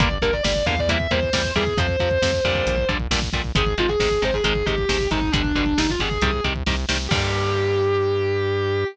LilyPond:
<<
  \new Staff \with { instrumentName = "Distortion Guitar" } { \time 4/4 \key g \phrygian \tempo 4 = 135 d''16 r16 bes'16 d''16 d''8 f''16 d''16 e''8 c''4 aes'8 | c''2~ c''8 r4. | aes'16 r16 f'16 aes'16 aes'8 c''16 aes'16 aes'8 g'4 ees'8 | d'4 ees'16 f'16 aes'4 r4. |
g'1 | }
  \new Staff \with { instrumentName = "Overdriven Guitar" } { \time 4/4 \key g \phrygian <d g bes>8 <d g bes>8 <d g bes>8 <d g bes>8 <c e g bes>8 <c e g bes>8 <c e g bes>8 <c e g bes>8 | <c f>8 <c f>8 <c f>8 <bes, d g>4 <bes, d g>8 <bes, d g>8 <bes, d g>8 | <c ees aes>8 <c ees aes>8 <c ees aes>8 <c ees aes>8 <c ees aes>8 <c ees aes>8 <c ees aes>8 <c ees aes>8 | <b, d g>8 <b, d g>8 <b, d g>8 <b, d g>8 <c ees g>8 <c ees g>8 <c ees g>8 <c ees g>8 |
<d g bes>1 | }
  \new Staff \with { instrumentName = "Synth Bass 1" } { \clef bass \time 4/4 \key g \phrygian g,,8 g,,8 g,,8 e,4 e,8 e,8 e,8 | f,8 f,8 f,8 f,8 bes,,8 bes,,8 bes,,8 bes,,8 | aes,,8 aes,,8 aes,,8 aes,,8 aes,,8 aes,,8 aes,,8 aes,,8 | g,,8 g,,8 g,,8 g,,8 c,8 c,8 c,8 c,8 |
g,1 | }
  \new DrumStaff \with { instrumentName = "Drums" } \drummode { \time 4/4 <hh bd>16 bd16 <hh bd>16 bd16 <bd sn>16 bd16 <hh bd>16 bd16 <hh bd>16 bd16 <hh bd>16 bd16 <bd sn>16 bd16 <hh bd>16 bd16 | <hh bd>16 bd16 <hh bd>16 bd16 <bd sn>16 bd16 <hh bd>16 bd16 <hh bd>16 bd16 <hh bd>16 bd16 <bd sn>16 bd16 <hh bd>16 bd16 | <hh bd>16 bd16 <hh bd>16 bd16 <bd sn>16 bd16 <hh bd>16 bd16 <hh bd>16 bd16 <hh bd>16 bd16 <bd sn>16 bd16 <hh bd>16 bd16 | <hh bd>16 bd16 <hh bd>16 bd16 <bd sn>16 bd16 <hh bd>16 bd16 <hh bd>16 bd16 <hh bd>16 bd16 <bd sn>8 sn8 |
<cymc bd>4 r4 r4 r4 | }
>>